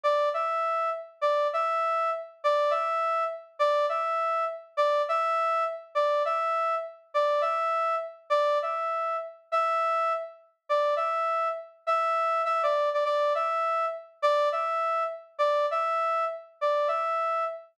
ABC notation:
X:1
M:4/4
L:1/8
Q:"Swing" 1/4=203
K:Em
V:1 name="Brass Section"
d2 e4 z2 | d2 e4 z2 | d2 e4 z2 | d2 e4 z2 |
d2 e4 z2 | d2 e4 z2 | d2 e4 z2 | d2 e4 z2 |
e5 z3 | d2 e4 z2 | e4 e d2 d | d2 e4 z2 |
d2 e4 z2 | d2 e4 z2 | d2 e4 z2 |]